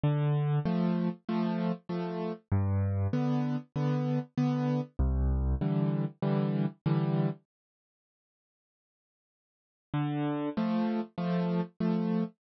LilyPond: \new Staff { \time 4/4 \key c \major \tempo 4 = 97 d4 <f a>4 <f a>4 <f a>4 | g,4 <d b>4 <d b>4 <d b>4 | c,4 <d e g>4 <d e g>4 <d e g>4 | r1 |
d4 <f a>4 <f a>4 <f a>4 | }